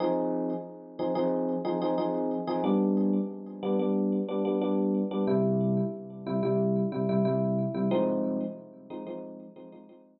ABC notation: X:1
M:4/4
L:1/16
Q:1/4=91
K:Fm
V:1 name="Electric Piano 1"
[F,CEA]6 [F,CEA] [F,CEA]3 [F,CEA] [F,CEA] [F,CEA]3 [F,CEA] | [G,=B,=D]6 [G,B,D] [G,B,D]3 [G,B,D] [G,B,D] [G,B,D]3 [G,B,D] | [C,G,=E]6 [C,G,E] [C,G,E]3 [C,G,E] [C,G,E] [C,G,E]3 [C,G,E] | [F,A,CE]6 [F,A,CE] [F,A,CE]3 [F,A,CE] [F,A,CE] [F,A,CE]3 z |]